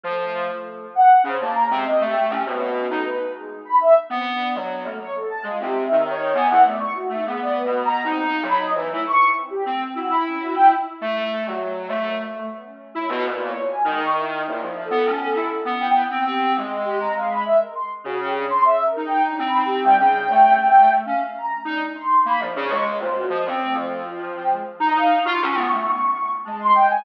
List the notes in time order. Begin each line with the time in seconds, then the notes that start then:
0.04 F3 A3
0.95 F#5
1.24 C#3 C5
1.40 A#3 A5
1.55 A#5
1.70 C3 G#3
1.85 D#5
2.00 A3
2.05 G4
2.25 G4
2.30 C#4
2.45 B2 C#4
2.60 F#4
2.75 C#4
2.90 A3 D#4
3.05 B4
3.35 G#3
3.65 B5
3.80 E5
4.10 B3 C4
4.25 D4
4.55 F#3
4.84 A3 A#3
5.00 C#5
5.15 A4
5.30 A5
5.43 G#3 F4
5.60 C3
5.65 G4
5.85 E5
5.91 D#3
6.05 C#5
6.34 B3 G#5
6.50 E3 F#5
6.65 A3 D5
6.80 C#6
6.95 F#4
7.09 A3 D#4
7.25 G#3 B3
7.40 D5
7.55 B4
7.65 B2
7.85 A#5
8.04 C4 D#4
8.25 F4
8.43 F#3 B5
8.60 D#5
8.75 E3 B3
8.90 A3 E4
9.05 C#6
9.35 C4
9.50 G4
9.65 A3 C4
9.95 E4 F#4
10.10 B5
10.25 C#4
10.40 F#4
10.55 G5
11.01 A3
11.46 F#3
11.88 A3
12.05 A#3
12.35 A3
12.50 B3
12.65 C#4
12.95 E4
13.10 B2
13.25 A#2 B4
13.45 C#5
13.65 G#5
13.85 D#3 G#3
14.00 C#6
14.15 E4
14.45 A#2 E4
14.62 F3
14.85 A4
14.91 B3
15.05 C#4
15.25 A4
15.35 E4
15.65 B3
15.80 G5
16.11 C4
16.25 C4 G4
16.56 G#3
16.85 G4
17.00 A#5
17.15 G#3 F5
17.30 B5
17.45 E5
17.60 A#4
17.75 C6
18.04 C#3 F#4
18.20 G4
18.35 D4
18.50 C6
18.65 E5
18.85 A#4
18.96 D#4
19.05 G5
19.25 D4
19.39 C4
19.45 B5
19.65 G4
19.84 G3 G5
19.99 C#3
20.30 A3
21.05 C#4 F5
21.35 A#5
21.65 D4 D#4
21.95 C6
22.25 A#3 B5
22.40 F3
22.45 D4
22.56 C#3
22.65 C#6
22.70 G#3
22.99 A#2 C5
23.15 F#4
23.30 F3 D#5
23.45 C4 C#4
23.60 A3
23.74 F3
24.05 F4
24.35 G5
24.50 G#3
24.80 D#4 A#5
24.94 D#4 F5
25.25 F4 C#6
25.42 C#4
25.54 B3
25.71 A3
26.45 G#3 A5
26.60 C6
26.75 G5
26.90 G#5